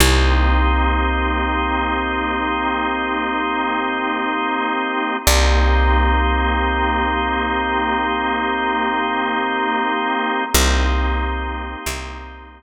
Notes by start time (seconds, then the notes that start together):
0.00 C2 A#3 C4 D#4 G4
5.27 C2 A#3 C4 D#4 G4
10.54 C2 A#3 C4 D#4 G4
11.86 C2